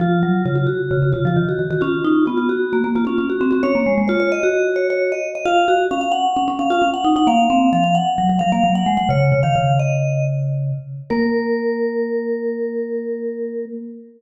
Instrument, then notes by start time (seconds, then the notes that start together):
vibraphone
0.00 F3 F4
0.23 F#3
0.45 C#3 F4
0.55 F4
0.67 F#4
0.91 C#3
1.02 C#3
1.12 C#3 F4
1.25 F3 F4
1.36 D#3
1.49 F#4
1.59 D#3
1.70 D#3 F#4
1.81 C#4 F4
2.04 D#4
2.26 B3 F4
2.37 F4
2.49 F#4
2.73 A#3
2.84 A#3
2.95 A#3 F4
3.05 C#4 F4
3.18 C#4
3.30 F#4
3.41 C4
3.51 C4 F#4
3.63 C#4 C#5
3.75 A#3
3.86 G#3
3.98 G#3
4.08 F4 C#5
4.20 C#5
4.32 D#5
4.43 F#4
4.76 C#5
4.90 C#5
5.12 D#5
5.35 D#5
5.45 F4 F5
5.68 F#4
5.91 C#4 F5
6.01 F5
6.12 F#5
6.36 C#4
6.48 C#4
6.59 C#4 F5
6.70 F4 F5
6.82 C#4
6.94 F#5
7.04 D#4
7.16 D#4 F#5
7.27 A#3 F5
7.50 C4
7.73 F3 F5
7.84 F5
7.95 F#5
8.18 F#3
8.29 F#3
8.39 F#3 F5
8.52 A#3 F5
8.64 F#3
8.75 F#5
8.86 G#3
8.97 G#3 F#5
9.09 C#3 C#5
9.32 C#3
9.43 D#3 F5
9.56 C#3
9.79 D#5
11.10 A#3 A#4